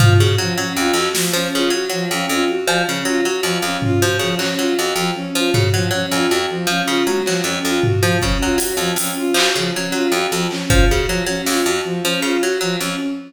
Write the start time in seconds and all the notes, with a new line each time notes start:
0.00 F3 F4, floor tom
0.18 C#3 F#4
0.38 F3 F#3
0.57 F#3 C#4
0.77 F2 F4
0.93 F2 F#4, clap
1.15 F3, snare
1.33 F3 C#4
1.54 C#3 F4
1.70 F#3 F#4
1.89 F3 F#3
2.11 F2 C#4
2.29 F2 F4
2.48 F#4
2.67 F3, cowbell
2.87 C#3 C#4
3.05 F#3 F4
3.25 F#3 F#4
3.43 F2 F3, cowbell
3.62 F2 C#4
3.82 F4, floor tom
4.00 F3 F#4
4.19 C#3 F3
4.38 F#3 C#4, clap
4.57 F#3 F4
4.77 F2 F#4
4.96 F2 F3
5.16 C#4
5.35 F3 F4
5.54 C#3 F#4, floor tom
5.73 F3 F#3
5.91 F#3 C#4
6.11 F2 F4, cowbell
6.29 F2 F#4
6.50 F3
6.67 F3 C#4
6.87 C#3 F4
7.07 F#3 F#4, high tom
7.26 F3 F#3, clap
7.44 F2 C#4
7.65 F2 F4
7.83 F#4, floor tom
8.02 F3
8.22 C#3 C#4, kick
8.42 F#3 F4
8.58 F#3 F#4, closed hi-hat
8.77 F2 F3
8.96 F2 C#4, closed hi-hat
9.17 F4
9.34 F3 F#4, clap
9.55 C#3 F3
9.75 F#3 C#4
9.92 F#3 F4
10.12 F2 F#4
10.32 F2 F3
10.51 C#4, clap
10.70 F3 F4, kick
10.89 C#3 F#4
11.07 F3 F#3
11.26 F#3 C#4
11.46 F2 F4, snare
11.65 F2 F#4
11.85 F3
12.03 F3 C#4
12.22 C#3 F4
12.43 F#3 F#4
12.61 F3 F#3
12.80 F2 C#4